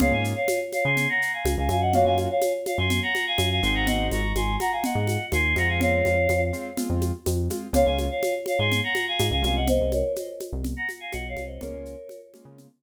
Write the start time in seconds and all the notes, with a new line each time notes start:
0.00 C#2 A#3 C#4 F4 G#4 C#5 F5, low conga, shaker
0.12 G#2 F5 G#5
0.24 shaker
0.36 C#5 F5
0.48 high conga, shaker
0.72 C#5 F5, high conga, shaker
0.85 C#3 G#5 C6
0.97 low conga, shaker
1.09 F#5 A#5
1.22 shaker
1.33 F5 G#5
1.45 C#2, high conga, shaker
1.57 C#2 F5 G#5
1.69 F#2 F5 G#5, high conga, shaker
1.81 D#5 F#5
1.93 A#3 C#4 F4 F#4 C#5 F5, low conga, shaker
2.05 F#2 F5 G#5
2.18 high conga, shaker
2.30 C#5 F5
2.41 high conga, shaker
2.66 C#5 F5, high conga, shaker
2.78 F#2 G#5 C6
2.90 low conga, shaker
3.02 F#5 A#5
3.15 high conga, shaker
3.27 F5 G#5
3.38 F#2, high conga, shaker
3.51 F5 G#5
3.63 G#1 G#3 C4 D#4 F#4 G#5 C6, shaker
3.75 F#5 A#5
3.87 D#5 F#5, low conga, shaker
4.11 G#1 A#5 C#6, high conga, shaker
4.35 G#1 G#5 C6, high conga, shaker
4.60 F#5 A#5, high conga, shaker
4.72 F5 G#5
4.84 D#5 F#5, low conga, shaker
4.95 G#2
5.07 high conga, shaker
5.32 D#2 G#5 C6, high conga, shaker
5.56 F2 G#3 C4 F4 F#5 A#5, high conga, shaker
5.68 F5 G#5
5.81 C#5 F5, low conga, shaker
6.05 F2, high conga, shaker
6.29 F2, high conga, shaker
6.53 G#3 C4 F4, shaker
6.77 G#3 C4 F4, low conga, shaker
6.90 F2
7.01 high conga, shaker
7.26 F2, high conga, shaker
7.50 G#3 C4 F4, high conga, shaker
7.73 C#2 G#3 A#3 C#4 F4 C#5 F5, low conga, shaker
7.86 C#2 F5 G#5
7.98 high conga, shaker
8.10 C#5 F5
8.23 high conga, shaker
8.46 C#5 F5, high conga, shaker
8.59 G#2 G#5 C6
8.72 low conga, shaker
8.83 F#5 A#5
8.95 high conga, shaker
9.08 F5 G#5
9.19 G#2, high conga, shaker
9.31 C#2 F5 G#5
9.42 C2 G#3 A#3 C#4 F4 F5 G#5, high conga, shaker
9.56 D#5 F#5
9.67 C5 D#5, low conga, shaker
9.81 C2
9.92 A#4 C#5, high conga, shaker
10.16 C5 D#5, high conga, shaker
10.40 high conga, shaker
10.53 C2
10.64 low conga, shaker
10.77 F#5 A#5
10.89 high conga, shaker
11.00 F5 G#5
11.12 B1 D#5 F#5, high conga, shaker
11.29 C#5 F5
11.36 C2, high conga, shaker
11.46 C5 D#5
11.61 C#2 G#3 A#3 C#4 F4 A#4 C#5, low conga, shaker
11.73 C#2
11.85 shaker
12.09 high conga, shaker
12.34 G#3 A#3 C#4 F4, high conga, shaker
12.45 C#3
12.58 low conga, shaker